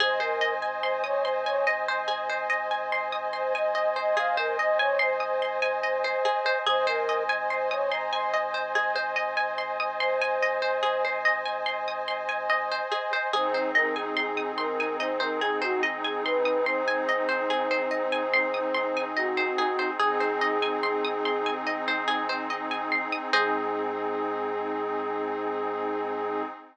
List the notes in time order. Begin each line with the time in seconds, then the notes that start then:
0.00 G#1 G#4 C5 D#5 G#5
0.20 A#4 C5
0.41 D#5
0.62 G#5
0.83 C5 C6
1.04 C#5 D#6
1.25 C5 C6
1.46 C#5 G#5
1.67 D#5
1.88 C5
2.08 G#4
2.30 C5
2.50 D#5
2.71 G#5
2.92 C6
3.12 D#6
3.33 C5 C6
3.54 D#5 G#5
3.75 D#5
3.96 C5 D#5
4.17 G#4 F5
4.37 A#4 C5
4.58 D#5
4.79 C#5 G#5
4.99 C5 C6
5.20 D#6
5.42 C6
5.62 G#5
5.83 D#5
6.04 C5
6.25 G#4
6.46 C5
6.66 G#1 G#4 C5 D#5 G#5
6.87 A#4 C5
7.09 D#5
7.29 G#5
7.50 C5 C6
7.71 C#5 D#6
7.91 A#5 C6
8.12 G#5 C6
8.34 D#5
8.54 C5
8.75 G#4
8.95 C5
9.16 D#5
9.37 G#5
9.58 C6
9.80 D#6
10.00 C5 C6
10.22 G#5
10.43 D#5
10.62 C5
10.83 G#4
11.05 C5
11.25 D#5
11.45 G#5
11.66 C6
11.88 D#6
12.08 C6
12.29 G#5
12.50 D#5
12.72 C5
12.92 G#4
13.13 C5
13.33 G#1 C4 D#4 G#4 C5
13.54 C5
13.75 A#4 D#5
13.96 G#4 G#5
14.16 G#4 C6
14.37 D#6
14.58 A#4 C6
14.80 G#5
15.00 C5 D#5
15.20 A#4 C5
15.41 G#4
15.62 F#4 C5
15.83 D#5
16.04 G#4 G#5
16.25 B4 C6
16.45 D#6
16.66 C5 C6
16.88 G#5
17.09 D#5
17.29 C5
17.50 G#4
17.71 C5
17.91 D#5
18.12 G#5
18.34 C6
18.54 D#6
18.74 C6
18.97 G#5
19.16 F#4 D#5
19.37 C5
19.58 G#4
19.79 C5
19.99 G#1 C4 D#4 G#4
20.20 C5
20.41 D#5
20.62 G#5
20.83 C6
21.05 D#6
21.25 C6
21.46 G#5
21.67 D#5
21.88 C5
22.08 G#4
22.29 C5
22.50 D#5
22.71 G#5
22.92 C6
23.12 D#6
23.33 G#2 C4 D#4 G#4 C5 D#5